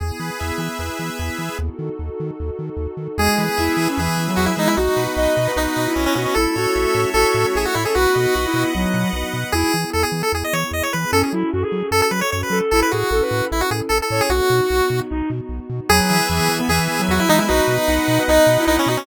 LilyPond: <<
  \new Staff \with { instrumentName = "Lead 1 (square)" } { \time 4/4 \key e \major \tempo 4 = 151 r1 | r1 | gis'2 gis'4 fis'16 e'16 dis'16 e'16 | dis'2 dis'4 cis'16 cis'16 cis'16 cis'16 |
a'2 a'4 gis'16 fis'16 e'16 gis'16 | fis'2 r2 | gis'4 a'16 gis'8 a'16 gis'16 dis''16 cis''8 dis''16 cis''16 b'8 | a'16 gis'16 r4. a'16 a'16 b'16 cis''16 cis''16 b'8 r16 |
a'16 b'16 fis'4. e'16 fis'16 gis'16 r16 a'16 a'8 gis'16 | fis'2 r2 | gis'2 gis'4 fis'16 e'16 dis'16 e'16 | dis'2 dis'4 dis'16 cis'16 dis'16 cis'16 | }
  \new Staff \with { instrumentName = "Flute" } { \time 4/4 \key e \major r1 | r1 | gis8. r16 e'8. cis'16 e8. fis8. gis8 | fis'8. r16 dis''8. b'16 dis'8. e'8. fis'8 |
e'8 fis'4. fis'16 fis'8 fis'16 gis'16 r8 a'16 | fis'8 fis'8 fis'16 e'8. fis4 r4 | e'8 r2. r8 | cis'8 e'8 fis'16 gis'8. r4. a'8 |
e'8 gis'8 a'16 b'8. r4. cis''8 | fis'2 dis'8 r4. | fis8. r16 e8. b16 e8. fis8. gis8 | fis'8. r16 dis'8. b'16 dis''8. e'8. fis'8 | }
  \new Staff \with { instrumentName = "Lead 1 (square)" } { \time 4/4 \key e \major gis'8 b'8 e''8 gis'8 b'8 e''8 gis'8 b'8 | r1 | gis'8 b'8 e''8 gis'8 b'8 e''8 gis'8 b'8 | fis'8 b'8 dis''8 fis'8 b'8 dis''8 fis'8 b'8 |
a'8 cis''8 e''8 a'8 cis''8 e''8 a'8 cis''8 | b'8 dis''8 fis''8 b'8 dis''8 fis''8 b'8 dis''8 | r1 | r1 |
r1 | r1 | b'8 e''8 gis''8 b'8 e''8 gis''8 b'8 e''8 | b'8 dis''8 fis''8 b'8 dis''8 fis''8 b'8 dis''8 | }
  \new Staff \with { instrumentName = "Synth Bass 1" } { \clef bass \time 4/4 \key e \major e,8 e8 e,8 e8 e,8 e8 e,8 e8 | dis,8 dis8 dis,8 dis8 dis,8 dis8 dis,8 dis8 | e,8 e8 e,8 e8 e,8 e8 e,8 e8 | b,,8 b,8 b,,8 b,8 b,,8 b,8 b,,8 b,8 |
a,,8 a,8 a,,8 a,8 a,,8 a,8 a,,8 a,8 | b,,8 b,8 b,,8 b,8 b,,8 b,8 b,,8 b,8 | e,8 e8 e,8 e8 e,8 e8 e,8 e8 | fis,8 fis8 fis,8 fis8 fis,8 fis8 fis,8 fis8 |
a,,8 a,8 a,,8 a,8 a,,8 a,8 a,,8 a,8 | b,,8 b,8 b,,8 b,8 b,,8 b,8 b,,8 b,8 | e,8 e8 e,8 e8 e,8 e8 e,8 e8 | b,,8 b,8 b,,8 b,8 b,,8 b,8 b,,8 b,8 | }
  \new Staff \with { instrumentName = "Pad 2 (warm)" } { \time 4/4 \key e \major <b e' gis'>1 | <dis' fis' a'>1 | <b e' gis'>1 | <b dis' fis'>1 |
<a cis' e'>1 | <b dis' fis'>1 | <b e' gis'>1 | <cis' fis' a'>1 |
<cis' e' a'>1 | <b dis' fis'>1 | <b e' gis'>1 | <b dis' fis'>1 | }
>>